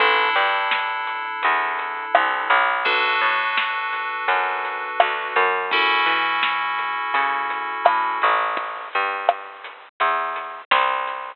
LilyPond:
<<
  \new Staff \with { instrumentName = "Electric Piano 2" } { \time 4/4 \key a \major \tempo 4 = 84 <d' e' a'>1 | <d' fis' a' b'>1 | <cis' e' fis' a'>1 | r1 | }
  \new Staff \with { instrumentName = "Electric Bass (finger)" } { \clef bass \time 4/4 \key a \major a,,8 g,4. e,4 c,8 b,,8~ | b,,8 a,4. fis,4 d,8 fis,8~ | fis,8 e4. cis4 a,8 a,,8~ | a,,8 g,4. e,4 c,4 | }
  \new DrumStaff \with { instrumentName = "Drums" } \drummode { \time 4/4 <hh bd>8 hh8 sn8 hh8 hh8 hh8 ss8 hh8 | <hh bd>8 hh8 sn8 hh8 hh8 hh8 ss8 hh8 | <hh bd>8 hh8 sn8 hh8 hh8 hh8 ss8 hh8 | <hh bd>8 hh8 ss8 hh8 hh8 hh8 sn8 hh8 | }
>>